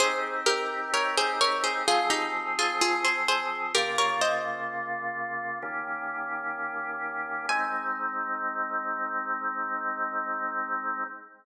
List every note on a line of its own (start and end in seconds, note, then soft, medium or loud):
0.00 1.84 C4 medium
0.00 1.84 D#4 medium
0.00 1.84 G4 medium
0.00 0.41 G#4 loud
0.00 0.41 C5 loud
0.46 0.92 G4 medium
0.46 0.92 A#4 medium
0.94 1.16 A#4 medium
0.94 1.16 C#5 loud
1.17 1.40 G#4 medium
1.17 1.40 C5 loud
1.41 1.63 A#4 medium
1.41 1.63 C#5 loud
1.64 1.86 G#4 medium
1.64 1.86 C5 medium
1.88 3.72 F3 medium
1.88 3.72 C4 medium
1.88 2.10 F4 medium
1.88 2.10 G#4 loud
1.88 3.72 G#4 medium
2.10 2.55 D#4 medium
2.10 2.55 G4 medium
2.59 2.81 F4 medium
2.59 2.81 G#4 loud
2.81 3.04 F4 medium
2.81 3.04 G#4 medium
3.04 3.27 G#4 medium
3.04 3.27 C5 medium
3.28 3.73 G#4 medium
3.28 3.73 C5 loud
3.75 5.58 C#3 medium
3.75 5.58 A#3 medium
3.75 5.58 F4 medium
3.75 3.97 G4 medium
3.75 3.97 A#4 loud
3.98 4.21 A#4 medium
3.98 4.21 C#5 loud
4.21 6.11 C5 medium
4.21 6.11 D#5 loud
5.62 7.46 D#3 medium
5.62 7.46 A#3 medium
5.62 7.46 C#4 medium
5.62 7.46 G4 medium
7.49 11.04 G#3 medium
7.49 11.04 C4 loud
7.49 11.04 D#4 medium
7.49 11.03 G#5 loud